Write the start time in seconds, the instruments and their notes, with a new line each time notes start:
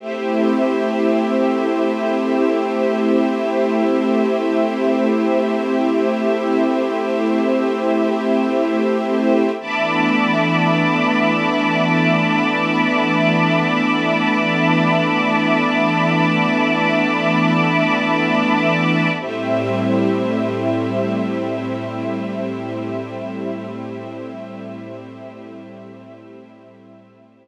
0.00 pad 5 (bowed) A3 C4 E4 G4, string ensemble 1 A3 G4 C5 E5
9.60 pad 5 (bowed) E3 A3 B3 D4, string ensemble 1 E5 A5 B5 D6
19.20 pad 5 (bowed) A2 G3 C4 E4, string ensemble 1 A3 G4 C5 E5